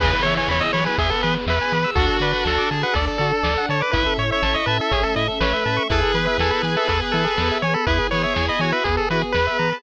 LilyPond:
<<
  \new Staff \with { instrumentName = "Lead 1 (square)" } { \time 4/4 \key e \major \tempo 4 = 122 b'8 cis''16 cis''16 cis''16 dis''16 cis''16 b'16 gis'16 a'16 b'16 r16 b'4 | a'8 b'16 b'16 a'8 r16 b'16 a'16 r16 a'4 cis''16 b'16 | b'8 cis''16 cis''16 cis''16 dis''16 b'16 a'16 gis'16 a'16 dis''16 r16 b'4 | a'8 b'16 b'16 a'8 r16 a'16 a'16 r16 a'4 cis''16 a'16 |
b'8 cis''16 cis''16 cis''16 dis''16 cis''16 b'16 gis'16 a'16 b'16 r16 b'4 | }
  \new Staff \with { instrumentName = "Clarinet" } { \time 4/4 \key e \major <cis e>4. fis8 b8. r4 r16 | <d' fis'>4. gis'8 d''8. r4 r16 | e''8. e''8. e''2 e''8 | <gis' b'>1 |
gis'8 gis'4 fis'8 r8 fis'16 r4 a'16 | }
  \new Staff \with { instrumentName = "Lead 1 (square)" } { \time 4/4 \key e \major gis'16 b'16 e''16 gis''16 b''16 e'''16 b''16 gis''16 e''16 b'16 gis'16 b'16 e''16 gis''16 b''16 e'''16 | fis'16 a'16 d''16 fis''16 a''16 d'''16 a''16 fis''16 d''16 a'16 fis'16 a'16 d''16 fis''16 a''16 d'''16 | e'16 a'16 cis''16 e''16 a''16 cis'''16 a''16 e''16 cis''16 a'16 e'16 a'16 cis''16 e''16 a''16 cis'''16 | e'16 gis'16 b'16 e''16 gis''16 b''16 gis''16 e''16 b'16 gis'16 e'16 gis'16 b'16 e''16 gis''16 b''16 |
e'16 gis'16 b'16 e''16 gis''16 b''16 gis''16 e''16 b'16 gis'16 e'16 gis'16 b'16 e''16 ais''16 b''16 | }
  \new Staff \with { instrumentName = "Synth Bass 1" } { \clef bass \time 4/4 \key e \major e,8 e8 e,8 e8 e,8 e8 e,8 e8 | d,8 d8 d,8 d8 d,8 d8 d,8 d8 | a,,8 a,8 a,,8 a,8 a,,8 a,8 a,,8 a,8 | e,8 e8 e,8 e8 e,8 e8 e,8 e8 |
e,8 e8 e,8 e8 e,8 e8 e,8 e8 | }
  \new Staff \with { instrumentName = "String Ensemble 1" } { \time 4/4 \key e \major <b e' gis'>2 <b gis' b'>2 | <d' fis' a'>2 <d' a' d''>2 | <cis' e' a'>2 <a cis' a'>2 | <b e' gis'>2 <b gis' b'>2 |
<b e' gis'>2 <b gis' b'>2 | }
  \new DrumStaff \with { instrumentName = "Drums" } \drummode { \time 4/4 <cymc bd>8 hh8 sn8 hh8 <hh bd>8 hh8 sn8 hh8 | <hh bd>8 hh8 sn8 hh8 <hh bd>8 hh8 sn8 hh8 | <hh bd>8 hh8 sn8 hh8 <hh bd>8 hh8 sn4 | <hh bd>8 hh8 sn8 hh8 <hh bd>8 hh8 sn8 hh8 |
<hh bd>8 hh8 sn8 hh8 <hh bd>8 hh8 sn8 hh8 | }
>>